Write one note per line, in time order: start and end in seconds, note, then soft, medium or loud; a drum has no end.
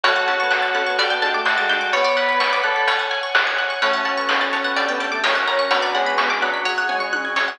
0.04 0.91 F#2 medium
0.04 0.27 A3 medium
0.04 0.12 C#4 medium
0.04 1.37 F#4 medium
0.04 0.12 F#4 medium
0.04 0.12 A4 medium
0.04 0.97 C#5 medium
0.04 0.15 C#5 medium
0.04 0.97 F#5 medium
0.04 0.97 A5 medium
0.04 kick medium
0.04 closed hi-hat medium
0.16 0.26 F#5 medium
0.28 0.44 C#4 medium
0.28 0.44 F#4 medium
0.28 0.44 A4 medium
0.28 0.38 A5 medium
0.28 kick medium
0.28 closed hi-hat medium
0.40 0.59 B3 medium
0.40 0.50 C#6 medium
0.51 0.61 F#6 medium
0.51 snare medium
0.62 0.73 A6 medium
0.75 0.83 C#4 medium
0.75 0.83 F#4 medium
0.75 0.83 A4 medium
0.75 0.85 F#6 medium
0.75 closed hi-hat medium
0.87 0.98 B3 medium
0.87 0.97 C#6 medium
0.98 1.85 D2 loud
0.98 1.07 D4 medium
0.98 1.07 G4 medium
0.98 1.07 A4 medium
0.98 1.10 D5 medium
0.98 1.92 D5 medium
0.98 1.93 G5 medium
0.98 1.93 A5 medium
0.98 kick medium
0.98 closed hi-hat medium
1.10 1.23 B3 medium
1.10 1.21 G5 medium
1.22 1.33 G#3 medium
1.22 1.39 D4 medium
1.22 1.39 G4 medium
1.22 1.39 A4 medium
1.22 1.33 A5 medium
1.22 closed hi-hat medium
1.34 1.55 A3 medium
1.34 1.45 D6 medium
1.45 1.88 F#4 medium
1.45 1.56 G6 medium
1.45 snare medium
1.58 1.89 G#3 medium
1.58 1.68 A6 medium
1.69 1.78 D4 medium
1.69 1.78 G4 medium
1.69 1.78 A4 medium
1.69 1.80 G6 medium
1.69 snare soft
1.69 closed hi-hat medium
1.81 1.92 D6 medium
1.92 2.62 B3 loud
1.92 2.86 C#5 medium
1.92 2.15 C#5 medium
1.92 2.04 C#5 medium
1.92 2.86 D5 medium
1.92 2.86 F#5 medium
1.92 2.86 B5 medium
1.92 kick medium
1.92 closed hi-hat medium
2.04 2.15 D5 medium
2.17 2.55 B4 medium
2.17 2.28 F#5 medium
2.17 kick medium
2.17 closed hi-hat medium
2.29 2.39 B5 medium
2.40 2.51 C#6 medium
2.40 snare medium
2.53 2.63 D6 medium
2.63 2.87 A4 medium
2.63 2.74 F#6 medium
2.63 closed hi-hat medium
2.76 2.87 B6 medium
2.88 3.81 C#5 medium
2.88 2.99 C#5 medium
2.88 3.81 F#5 medium
2.88 3.81 G#5 medium
2.88 kick medium
2.88 closed hi-hat medium
2.99 3.10 F#5 medium
3.11 3.22 G#5 medium
3.11 closed hi-hat medium
3.23 3.34 C#6 medium
3.35 3.46 F#6 medium
3.35 snare medium
3.47 3.58 G#6 medium
3.58 3.69 F#6 medium
3.58 closed hi-hat soft
3.70 3.81 C#6 medium
3.81 4.69 F#2 medium
3.81 4.01 A3 medium
3.81 5.02 C#4 medium
3.81 4.77 C#4 medium
3.81 4.77 F#4 medium
3.81 4.77 A4 medium
3.81 3.90 C#5 medium
3.81 3.93 C#5 medium
3.81 3.90 F#5 medium
3.81 3.90 A5 medium
3.81 kick medium
3.81 closed hi-hat medium
3.93 4.04 F#5 medium
4.05 4.22 C#5 medium
4.05 4.22 F#5 medium
4.05 4.16 A5 medium
4.05 4.22 A5 medium
4.05 kick medium
4.05 closed hi-hat medium
4.16 4.36 B3 medium
4.16 4.28 C#6 medium
4.29 4.39 F#6 medium
4.29 snare medium
4.41 4.52 A6 medium
4.53 4.63 C#5 medium
4.53 4.61 C#5 medium
4.53 4.61 F#5 medium
4.53 4.61 A5 medium
4.53 closed hi-hat soft
4.63 4.74 B3 medium
4.63 4.75 F#5 medium
4.76 5.20 D2 loud
4.76 5.24 D4 medium
4.76 5.24 G4 medium
4.76 5.24 A4 medium
4.76 4.85 D5 medium
4.76 4.87 D5 medium
4.76 4.85 G5 medium
4.76 4.85 A5 medium
4.76 kick medium
4.76 closed hi-hat medium
4.88 5.00 B3 loud
4.88 4.99 G5 medium
5.00 5.11 A3 medium
5.00 5.08 D5 medium
5.00 5.08 G5 medium
5.00 5.08 A5 medium
5.00 5.11 A5 medium
5.00 closed hi-hat medium
5.11 5.34 A3 medium
5.11 5.22 D6 medium
5.24 5.67 F#2 medium
5.24 5.71 C#4 medium
5.24 5.67 C#4 medium
5.24 5.71 F#4 medium
5.24 5.71 A#4 medium
5.24 5.34 C#5 medium
5.24 5.32 C#5 medium
5.24 5.32 F#5 medium
5.24 5.32 A#5 medium
5.24 snare medium
5.35 5.66 C#4 medium
5.35 5.46 F#5 medium
5.47 5.56 C#5 medium
5.47 5.56 F#5 medium
5.47 5.56 A#5 medium
5.47 5.58 A#5 medium
5.47 snare soft
5.47 closed hi-hat medium
5.59 5.70 C#6 medium
5.71 6.58 B1 medium
5.71 5.91 F#3 medium
5.71 6.62 B3 medium
5.71 6.65 C#4 medium
5.71 6.65 D4 medium
5.71 6.65 F#4 medium
5.71 6.65 B4 medium
5.71 5.81 C#5 medium
5.71 5.79 C#5 medium
5.71 5.79 D5 medium
5.71 5.79 F#5 medium
5.71 5.79 B5 medium
5.71 kick medium
5.71 closed hi-hat medium
5.82 5.93 D5 medium
5.94 6.36 G#3 medium
5.94 6.11 C#5 medium
5.94 6.11 D5 medium
5.94 6.05 F#5 medium
5.94 6.11 F#5 medium
5.94 6.11 B5 medium
5.94 closed hi-hat soft
6.06 6.17 B5 medium
6.18 6.29 C#6 medium
6.18 snare medium
6.30 6.41 D6 medium
6.42 6.82 F#3 medium
6.42 6.50 C#5 medium
6.42 6.50 D5 medium
6.42 6.50 F#5 medium
6.42 6.50 B5 medium
6.42 6.53 F#6 medium
6.42 closed hi-hat medium
6.54 6.64 B6 medium
6.65 7.10 C#2 loud
6.65 7.59 C#4 medium
6.65 7.59 F#4 medium
6.65 7.59 G#4 medium
6.65 6.74 C#5 medium
6.65 6.76 C#5 medium
6.65 6.74 F#5 medium
6.65 6.74 G#5 medium
6.65 kick medium
6.65 floor tom medium
6.78 6.88 F#5 medium
6.89 7.06 C#5 medium
6.89 7.06 F#5 medium
6.89 7.00 G#5 medium
6.89 7.06 G#5 medium
6.89 mid tom medium
7.00 7.11 C#6 medium
7.13 7.34 E2 medium
7.13 7.23 F#6 medium
7.13 high tom medium
7.25 7.35 G#6 medium
7.36 7.58 F2 medium
7.36 7.44 C#5 medium
7.36 7.47 C#5 medium
7.36 7.44 F#5 medium
7.36 7.44 G#5 medium
7.36 snare medium
7.48 7.59 F#5 medium